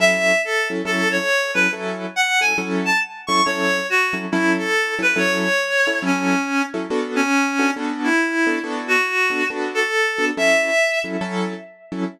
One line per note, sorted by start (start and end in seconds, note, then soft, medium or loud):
0.00 0.32 F#3 medium
0.00 0.32 C#4 loud
0.00 0.32 E4 loud
0.00 0.32 A4 medium
0.00 0.42 E5 loud
0.44 0.68 A4 loud
0.70 0.82 F#3 medium
0.70 0.82 C#4 medium
0.70 0.82 E4 medium
0.70 0.82 A4 medium
0.85 1.18 F#3 medium
0.85 1.18 C#4 medium
0.85 1.18 E4 medium
0.85 1.18 A4 loud
0.85 1.08 A4 loud
1.12 1.51 C#5 loud
1.54 1.67 F#3 medium
1.54 1.67 C#4 medium
1.54 1.67 E4 medium
1.54 1.67 A4 medium
1.54 1.71 B4 medium
1.73 2.05 F#3 medium
1.73 2.05 C#4 medium
1.73 2.05 E4 loud
1.73 2.05 A4 loud
2.16 2.40 F#5 loud
2.41 2.53 F#3 medium
2.41 2.53 C#4 medium
2.41 2.53 E4 medium
2.41 2.53 A4 medium
2.41 2.56 G#5 loud
2.58 2.90 F#3 medium
2.58 2.90 C#4 loud
2.58 2.90 E4 medium
2.58 2.90 A4 loud
2.85 3.00 A5 loud
3.27 3.41 F#3 medium
3.27 3.41 C#4 medium
3.27 3.41 E4 medium
3.27 3.41 A4 medium
3.27 3.42 C#6 medium
3.46 3.79 F#3 medium
3.46 3.79 C#4 medium
3.46 3.79 E4 medium
3.46 3.79 A4 loud
3.46 3.87 C#5 loud
3.90 4.14 F#4 loud
4.13 4.25 F#3 medium
4.13 4.25 C#4 medium
4.13 4.25 E4 medium
4.13 4.25 A4 medium
4.32 4.65 F#3 loud
4.32 4.65 C#4 loud
4.32 4.53 E4 medium
4.32 4.65 E4 loud
4.32 4.65 A4 medium
4.58 4.94 A4 loud
4.99 5.11 F#3 medium
4.99 5.11 C#4 medium
4.99 5.11 E4 medium
4.99 5.11 A4 medium
4.99 5.19 B4 loud
5.16 5.48 F#3 loud
5.16 5.48 C#4 medium
5.16 5.48 E4 medium
5.16 5.48 A4 loud
5.16 5.98 C#5 loud
5.87 5.99 F#3 medium
5.87 5.99 C#4 medium
5.87 5.99 E4 medium
5.87 5.99 A4 medium
6.02 6.35 F#3 loud
6.02 6.35 C#4 medium
6.02 6.62 C#4 medium
6.02 6.35 E4 medium
6.02 6.35 A4 medium
6.74 6.86 F#3 medium
6.74 6.86 C#4 medium
6.74 6.86 E4 medium
6.74 6.86 A4 medium
6.90 7.23 B3 medium
6.90 7.23 D4 medium
6.90 7.23 F#4 medium
6.90 7.23 A4 medium
7.16 7.71 C#4 loud
7.59 7.71 B3 medium
7.59 7.71 D4 medium
7.59 7.71 F#4 medium
7.59 7.71 A4 medium
7.76 8.09 B3 loud
7.76 8.09 D4 medium
7.76 8.09 F#4 medium
7.76 8.09 A4 medium
8.03 8.59 E4 medium
8.47 8.59 B3 medium
8.47 8.59 D4 medium
8.47 8.59 F#4 medium
8.47 8.59 A4 loud
8.64 8.96 B3 loud
8.64 8.96 D4 medium
8.64 8.96 F#4 loud
8.64 8.96 A4 loud
8.88 9.45 F#4 medium
9.30 9.43 B3 medium
9.30 9.43 D4 medium
9.30 9.43 F#4 medium
9.30 9.43 A4 medium
9.50 9.83 B3 medium
9.50 9.83 D4 medium
9.50 9.83 F#4 medium
9.50 9.83 A4 medium
9.75 10.25 A4 medium
10.18 10.31 B3 medium
10.18 10.31 D4 medium
10.18 10.31 F#4 medium
10.18 10.31 A4 medium
10.37 10.70 F#3 medium
10.37 10.70 C#4 loud
10.37 10.70 E4 loud
10.37 10.70 A4 loud
10.37 10.99 E5 loud
11.04 11.16 F#3 medium
11.04 11.16 C#4 medium
11.04 11.16 E4 medium
11.04 11.16 A4 medium
11.21 11.54 F#3 medium
11.21 11.54 C#4 medium
11.21 11.54 E4 medium
11.21 11.54 A4 loud
11.92 12.04 F#3 medium
11.92 12.04 C#4 medium
11.92 12.04 E4 medium
11.92 12.04 A4 medium